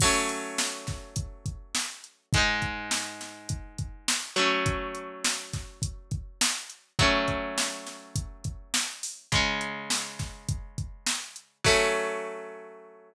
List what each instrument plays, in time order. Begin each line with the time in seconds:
0.00 overdriven guitar F#3 A3, kick, crash
0.05 overdriven guitar C#4
0.29 closed hi-hat
0.58 snare
0.87 kick, snare, closed hi-hat
1.16 kick, closed hi-hat
1.46 kick, closed hi-hat
1.75 snare
2.04 closed hi-hat
2.33 overdriven guitar G#2 G#3, kick, closed hi-hat
2.38 overdriven guitar D#4
2.62 kick, closed hi-hat
2.91 snare
3.21 snare, closed hi-hat
3.49 kick, closed hi-hat
3.78 kick, closed hi-hat
4.08 snare
4.36 overdriven guitar F#3 A3 C#4, closed hi-hat
4.66 kick, closed hi-hat
4.95 closed hi-hat
5.25 snare
5.53 kick, snare, closed hi-hat
5.82 kick, closed hi-hat
6.11 kick, closed hi-hat
6.41 snare
6.70 closed hi-hat
6.99 overdriven guitar F#3 A3 C#4, kick, closed hi-hat
7.28 kick, closed hi-hat
7.58 snare
7.87 snare, closed hi-hat
8.16 kick, closed hi-hat
8.44 kick, closed hi-hat
8.74 snare
9.03 open hi-hat
9.32 overdriven guitar C#3 G#3 C#4, kick, closed hi-hat
9.61 closed hi-hat
9.90 snare
10.19 kick, snare, closed hi-hat
10.49 kick, closed hi-hat
10.78 kick, closed hi-hat
11.07 snare
11.36 closed hi-hat
11.64 overdriven guitar F#3 A3 C#4, kick, crash